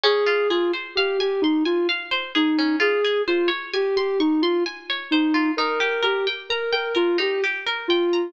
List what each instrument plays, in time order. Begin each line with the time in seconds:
0.03 pizzicato strings C#4, ocarina G#4
0.27 pizzicato strings F4
0.50 ocarina F4, pizzicato strings G#4
0.73 pizzicato strings C5
0.96 ocarina G4, pizzicato strings F5
1.19 ocarina G4, pizzicato strings G#5
1.42 ocarina D#4, pizzicato strings C6
1.65 ocarina F4, pizzicato strings G#5
1.89 pizzicato strings F5
2.11 pizzicato strings C5
2.35 ocarina D#4, pizzicato strings G#4
2.59 pizzicato strings C#4
2.80 pizzicato strings F4, ocarina G#4
3.05 pizzicato strings G#4
3.28 ocarina F4, pizzicato strings C5
3.48 pizzicato strings C#5
3.73 ocarina G4, pizzicato strings G#5
3.96 ocarina G4, pizzicato strings C6
4.20 ocarina D#4, pizzicato strings C#6
4.42 ocarina F4, pizzicato strings C6
4.66 pizzicato strings G#5
4.90 pizzicato strings C#5
5.11 ocarina D#4, pizzicato strings C5
5.34 pizzicato strings F4
5.57 pizzicato strings D#4, ocarina A#4
5.80 pizzicato strings G4
6.03 ocarina G4, pizzicato strings A#4
6.27 pizzicato strings G5
6.50 ocarina A#4, pizzicato strings A#5
6.73 ocarina A#4, pizzicato strings G5
6.95 ocarina F4, pizzicato strings A#4
7.18 pizzicato strings D#4, ocarina G4
7.44 pizzicato strings G4
7.67 pizzicato strings A#4
7.88 ocarina F4, pizzicato strings G5
8.13 pizzicato strings A#5